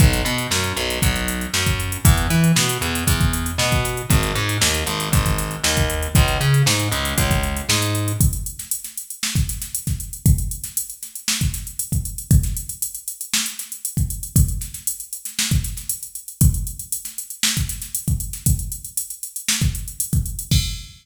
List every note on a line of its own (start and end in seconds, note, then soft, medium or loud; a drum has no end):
0.00 0.21 B1 loud
0.00 kick loud
0.00 closed hi-hat loud
0.13 closed hi-hat medium
0.25 0.47 B2 medium
0.25 closed hi-hat medium
0.38 closed hi-hat medium
0.51 0.73 F#2 medium
0.51 snare loud
0.64 closed hi-hat medium
0.76 0.98 B1 medium
0.76 closed hi-hat medium
0.90 closed hi-hat medium
1.02 1.46 B1 medium
1.02 kick loud
1.02 closed hi-hat loud
1.16 closed hi-hat medium
1.28 closed hi-hat loud
1.41 closed hi-hat medium
1.54 1.97 F#2 medium
1.54 snare loud
1.66 kick medium
1.66 closed hi-hat medium
1.80 closed hi-hat medium
1.92 closed hi-hat medium
2.05 2.26 E2 medium
2.05 kick loud
2.05 closed hi-hat loud
2.18 closed hi-hat medium
2.30 2.52 E3 medium
2.30 snare soft
2.30 closed hi-hat medium
2.44 closed hi-hat medium
2.56 2.78 B2 medium
2.56 snare loud
2.69 closed hi-hat loud
2.81 3.03 E2 medium
2.81 closed hi-hat medium
2.95 closed hi-hat medium
3.07 3.51 E2 medium
3.07 kick medium
3.07 closed hi-hat loud
3.21 kick loud
3.21 closed hi-hat medium
3.33 closed hi-hat loud
3.46 closed hi-hat medium
3.58 4.02 B2 medium
3.58 snare loud
3.72 kick medium
3.72 snare soft
3.72 closed hi-hat medium
3.85 snare soft
3.85 closed hi-hat medium
3.97 closed hi-hat medium
4.10 4.32 G#1 medium
4.10 kick loud
4.10 closed hi-hat loud
4.23 closed hi-hat medium
4.35 4.57 G#2 medium
4.35 snare soft
4.35 closed hi-hat medium
4.49 closed hi-hat medium
4.61 4.83 D#2 medium
4.61 snare loud
4.74 closed hi-hat medium
4.86 5.08 G#1 medium
4.86 closed hi-hat medium
5.00 closed hi-hat medium
5.12 5.56 G#1 medium
5.12 kick loud
5.12 closed hi-hat loud
5.26 kick medium
5.26 closed hi-hat medium
5.38 snare soft
5.38 closed hi-hat medium
5.51 closed hi-hat medium
5.64 6.07 D#2 medium
5.64 snare loud
5.77 kick medium
5.77 closed hi-hat medium
5.90 closed hi-hat medium
6.03 closed hi-hat medium
6.15 6.37 C#2 medium
6.15 kick loud
6.15 closed hi-hat loud
6.28 closed hi-hat medium
6.40 6.62 C#3 medium
6.40 closed hi-hat medium
6.54 closed hi-hat medium
6.66 6.88 G#2 medium
6.66 snare loud
6.79 closed hi-hat medium
6.92 7.13 C#2 medium
6.92 closed hi-hat medium
7.05 closed hi-hat medium
7.18 7.61 C#2 medium
7.18 kick medium
7.18 closed hi-hat loud
7.31 kick medium
7.31 closed hi-hat medium
7.43 closed hi-hat medium
7.57 closed hi-hat medium
7.69 8.12 G#2 medium
7.69 snare loud
7.82 closed hi-hat medium
7.95 closed hi-hat medium
8.08 closed hi-hat medium
8.21 kick loud
8.21 closed hi-hat loud
8.33 closed hi-hat medium
8.46 closed hi-hat medium
8.59 snare soft
8.59 closed hi-hat medium
8.71 closed hi-hat loud
8.84 snare soft
8.84 closed hi-hat medium
8.97 closed hi-hat medium
9.10 closed hi-hat medium
9.23 snare loud
9.35 kick loud
9.35 snare medium
9.35 closed hi-hat medium
9.49 snare soft
9.49 closed hi-hat loud
9.62 snare medium
9.62 closed hi-hat medium
9.75 closed hi-hat loud
9.87 kick medium
9.87 snare soft
9.87 closed hi-hat medium
10.00 closed hi-hat medium
10.13 closed hi-hat medium
10.26 kick loud
10.26 closed hi-hat loud
10.38 closed hi-hat medium
10.51 closed hi-hat medium
10.64 snare soft
10.64 closed hi-hat medium
10.77 closed hi-hat loud
10.90 closed hi-hat medium
11.03 snare soft
11.03 closed hi-hat medium
11.15 closed hi-hat medium
11.28 snare loud
11.41 kick medium
11.41 closed hi-hat medium
11.54 snare soft
11.54 closed hi-hat medium
11.67 closed hi-hat medium
11.79 closed hi-hat loud
11.92 kick medium
11.92 closed hi-hat medium
12.05 closed hi-hat medium
12.18 closed hi-hat medium
12.31 kick loud
12.31 closed hi-hat loud
12.43 snare soft
12.43 closed hi-hat medium
12.57 closed hi-hat medium
12.69 closed hi-hat medium
12.82 closed hi-hat loud
12.95 closed hi-hat medium
13.08 closed hi-hat loud
13.21 closed hi-hat medium
13.34 snare loud
13.46 closed hi-hat medium
13.59 snare soft
13.59 closed hi-hat medium
13.72 closed hi-hat medium
13.85 closed hi-hat loud
13.97 kick loud
13.97 closed hi-hat medium
14.10 closed hi-hat medium
14.23 closed hi-hat medium
14.36 kick loud
14.36 closed hi-hat loud
14.48 closed hi-hat medium
14.61 snare soft
14.61 closed hi-hat medium
14.74 snare soft
14.74 closed hi-hat medium
14.87 closed hi-hat loud
15.00 closed hi-hat medium
15.13 closed hi-hat medium
15.25 snare soft
15.25 closed hi-hat medium
15.39 snare loud
15.51 kick loud
15.51 closed hi-hat medium
15.64 snare soft
15.64 closed hi-hat medium
15.77 snare soft
15.77 closed hi-hat medium
15.89 closed hi-hat loud
16.03 closed hi-hat medium
16.15 closed hi-hat medium
16.28 closed hi-hat medium
16.41 kick loud
16.41 closed hi-hat loud
16.54 closed hi-hat medium
16.67 closed hi-hat medium
16.79 closed hi-hat medium
16.92 closed hi-hat loud
17.05 snare soft
17.05 closed hi-hat medium
17.18 closed hi-hat medium
17.30 closed hi-hat medium
17.43 snare loud
17.57 kick medium
17.57 closed hi-hat medium
17.69 snare soft
17.69 closed hi-hat medium
17.82 snare soft
17.82 closed hi-hat medium
17.95 closed hi-hat loud
18.08 kick loud
18.08 closed hi-hat medium
18.20 closed hi-hat medium
18.33 snare soft
18.33 closed hi-hat medium
18.46 kick loud
18.46 closed hi-hat loud
18.59 closed hi-hat medium
18.72 closed hi-hat medium
18.85 closed hi-hat medium
18.97 closed hi-hat loud
19.10 closed hi-hat medium
19.23 closed hi-hat medium
19.36 closed hi-hat medium
19.49 snare loud
19.61 kick loud
19.61 closed hi-hat medium
19.75 closed hi-hat medium
19.88 closed hi-hat medium
20.00 closed hi-hat loud
20.13 kick loud
20.13 closed hi-hat medium
20.26 closed hi-hat medium
20.39 closed hi-hat medium
20.51 kick loud
20.51 crash loud